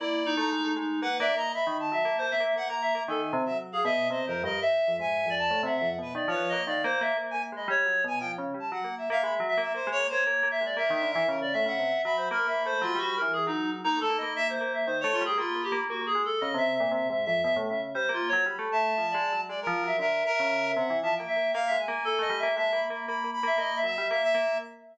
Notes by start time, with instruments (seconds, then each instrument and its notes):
0.00 tubular bells A#3, clarinet E4 D5
0.26 clarinet D#4
0.37 tubular bells A3, clarinet A#5
0.52 tubular bells G#3
0.65 tubular bells A3
0.76 tubular bells G#3, clarinet D#4
1.02 tubular bells A#3, clarinet B4 F#5
1.19 tubular bells A#3, clarinet D5 E5
1.35 tubular bells A#3, clarinet D#5 A#5
1.54 clarinet E5 B5
1.67 tubular bells D#3
1.80 clarinet A5
1.92 tubular bells F#3, clarinet E5
2.05 tubular bells A#3
2.18 tubular bells A#3, clarinet C5
2.31 clarinet E5
2.40 tubular bells A#3, clarinet E5
2.56 tubular bells A#3, clarinet F#5
2.69 tubular bells A#3, clarinet A#5
2.82 clarinet E5
2.95 tubular bells A#3
3.08 tubular bells D#3, clarinet A4 G#5
3.33 tubular bells C3
3.46 tubular bells F#3, clarinet E5
3.72 clarinet G#4 F5
3.85 tubular bells B2, clarinet D#5 E5
4.10 tubular bells C3, clarinet C5 D#5
4.26 tubular bells F2, clarinet A#4 C5
4.44 tubular bells G2, clarinet A#4 D#5
4.61 clarinet E5
4.88 tubular bells F2
4.96 tubular bells G#2, clarinet E5
5.00 clarinet G#5
5.26 tubular bells F2
5.30 clarinet D5
5.39 clarinet A5
5.51 tubular bells A2
5.63 tubular bells C3, clarinet E5 F#5
5.77 clarinet E5
5.81 tubular bells F2
5.98 tubular bells B2, clarinet B4
6.15 tubular bells D#3, clarinet D5
6.28 tubular bells F3, clarinet C#5
6.32 clarinet B4
6.49 tubular bells A#3, clarinet D#5
6.66 tubular bells D#3, clarinet D5 F5
6.84 tubular bells A#3, clarinet C5
7.01 tubular bells A#3, clarinet E5
7.17 tubular bells A#3
7.31 tubular bells A#3, clarinet G#5
7.52 tubular bells G#3, clarinet D#5 B5
7.68 tubular bells G3, clarinet C#5
7.86 tubular bells F#3
8.04 tubular bells B2, clarinet G#5
8.20 tubular bells F3, clarinet G5
8.38 tubular bells C#3
8.54 tubular bells G3
8.60 clarinet A5
8.72 tubular bells F#3, clarinet F#5
8.84 tubular bells A#3
8.98 clarinet E5
9.10 tubular bells A#3, clarinet E5 F5
9.23 tubular bells G#3, clarinet E5 B5
9.40 tubular bells F#3
9.49 clarinet E5
9.58 tubular bells A#3, clarinet E5
9.74 tubular bells A#3, clarinet C5
9.87 tubular bells G#3
9.92 clarinet C#5
10.00 tubular bells A#3
10.09 tubular bells A#3, clarinet C5 C#5
10.27 tubular bells A#3
10.43 tubular bells A#3
10.51 clarinet E5
10.61 tubular bells G#3
10.65 clarinet D5
10.77 tubular bells A#3, clarinet A#4 E5
10.90 tubular bells D#3, clarinet E5
11.02 tubular bells D3
11.11 clarinet E5
11.15 tubular bells E3
11.28 tubular bells C#3, clarinet A#4
11.41 clarinet D5
11.53 tubular bells A2, clarinet E5
11.66 tubular bells C#3, clarinet E5 F#5
11.79 tubular bells C3
12.04 tubular bells F#3, clarinet E5 B5
12.17 clarinet C5
12.30 tubular bells A#3, clarinet A#4 B5
12.47 tubular bells A#3, clarinet E5
12.65 tubular bells A3, clarinet C5
12.82 tubular bells F#3, clarinet F4
12.95 tubular bells G3, clarinet F#4
13.16 clarinet A#4
13.22 tubular bells E3
13.33 clarinet G#4
13.47 tubular bells F#3, clarinet D#4
13.84 tubular bells A#3, clarinet D#4 A#5
13.97 tubular bells A3, clarinet A4
14.02 clarinet A5
14.10 tubular bells A#3
14.18 clarinet D#5 B5
14.23 tubular bells A#3
14.36 clarinet E5
14.49 clarinet C5
14.61 tubular bells A#3
14.74 clarinet E5
14.87 tubular bells D#3, clarinet C5
15.01 tubular bells A3, clarinet C#5
15.13 clarinet F4
15.21 tubular bells G3
15.25 clarinet G#4 G5
15.38 tubular bells A#3, clarinet F4 B5
15.55 tubular bells A#3
15.63 clarinet G4
15.72 tubular bells A#3
15.90 tubular bells A#3, clarinet F#4
16.01 tubular bells A#3
16.06 clarinet G#4
16.15 tubular bells G#3
16.25 clarinet A4
16.41 tubular bells C#3, clarinet D#5
16.54 tubular bells C3, clarinet E5
16.76 clarinet E5
16.80 tubular bells A#2
16.91 tubular bells C3, clarinet E5
17.10 tubular bells G#2, clarinet E5
17.25 tubular bells F2, clarinet E5
17.43 tubular bells B2, clarinet E5
17.56 tubular bells A2
17.68 tubular bells C#3, clarinet E5
17.95 tubular bells G3, clarinet C5
18.09 tubular bells A#3
18.13 clarinet F4
18.28 clarinet C#5
18.33 tubular bells F#3
18.46 tubular bells G3, clarinet B5
18.59 tubular bells A3
18.72 clarinet E5 A5
18.98 tubular bells F3
19.11 tubular bells G#3, clarinet D5
19.32 tubular bells F#3
19.49 tubular bells G#3, clarinet D5
19.62 clarinet A#4
19.67 tubular bells F3
19.84 tubular bells F#3, clarinet E5
19.99 tubular bells D3, clarinet A#4 E5
20.26 clarinet A#4
20.34 clarinet E5
20.40 tubular bells C#3
20.68 clarinet E5
20.76 tubular bells C3, clarinet F#5
20.90 tubular bells E3
21.03 tubular bells F3, clarinet E5 A5
21.16 clarinet G5
21.20 tubular bells A#3
21.28 clarinet E5
21.36 tubular bells A#3
21.54 tubular bells A#3, clarinet F5
21.67 tubular bells G#3, clarinet E5
21.79 clarinet G#5
21.88 tubular bells A#3
22.05 tubular bells A#3, clarinet A4
22.19 tubular bells A3, clarinet D#5
22.30 tubular bells G3
22.39 tubular bells A#3, clarinet E5
22.56 tubular bells G#3, clarinet E5 A5
22.73 tubular bells A#3, clarinet B5
22.90 tubular bells A#3, clarinet B5
23.07 tubular bells A#3, clarinet B5
23.24 tubular bells A#3
23.34 clarinet B5
23.43 tubular bells A#3, clarinet E5
23.58 tubular bells A#3, clarinet D#5
23.76 clarinet E5
23.84 tubular bells F#3, clarinet E5
23.94 tubular bells G3, clarinet E5
24.10 tubular bells A#3, clarinet E5 F5
24.23 clarinet E5
24.35 tubular bells A#3